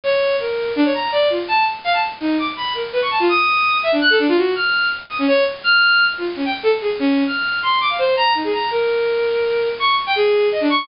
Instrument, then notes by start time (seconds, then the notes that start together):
violin
0.04 C#5
0.40 A#4
0.76 D4
0.85 C#5
0.94 A#5
1.12 D5
1.30 F4
1.48 A5
1.84 F5
1.93 A5
2.20 D#4
2.38 D6
2.57 B5
2.75 A#4
2.93 B4
3.02 C#6
3.11 A5
3.20 F4
3.29 D#6
3.83 E5
3.92 D4
4.01 F#6
4.10 A4
4.19 D4
4.28 F4
4.37 F#4
4.55 F6
5.10 D#6
5.19 C#4
5.28 C#5
5.64 F6
6.18 F4
6.36 C#4
6.45 G5
6.63 A4
6.81 G#4
6.99 C#4
7.26 F6
7.63 C6
7.81 D6
7.90 F5
7.99 C5
8.17 A#5
8.35 D#4
8.44 G#4
8.53 A#5
8.71 A#4
9.79 C#6
10.07 G5
10.16 G#4
10.52 D#5
10.61 D4
10.70 C#6